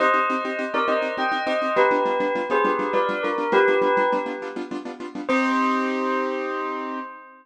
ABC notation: X:1
M:12/8
L:1/8
Q:3/8=136
K:Cm
V:1 name="Tubular Bells"
[ce]5 [Bd] [ce]2 [eg]2 [ce]2 | [G=B]5 [Ac] [GB]2 [Bd]2 ^A2 | [G=B]5 z7 | c12 |]
V:2 name="Acoustic Grand Piano"
[CEG] [CEG] [CEG] [CEG] [CEG] [CEG] [CEG] [CEG] [CEG] [CEG] [CEG] [CEG] | [G,=B,DF] [G,B,DF] [G,B,DF] [G,B,DF] [G,B,DF] [G,B,DF] [G,B,DF] [G,B,DF] [G,B,DF] [G,B,DF] [G,B,DF] [G,B,DF] | [G,=B,DF] [G,B,DF] [G,B,DF] [G,B,DF] [G,B,DF] [G,B,DF] [G,B,DF] [G,B,DF] [G,B,DF] [G,B,DF] [G,B,DF] [G,B,DF] | [CEG]12 |]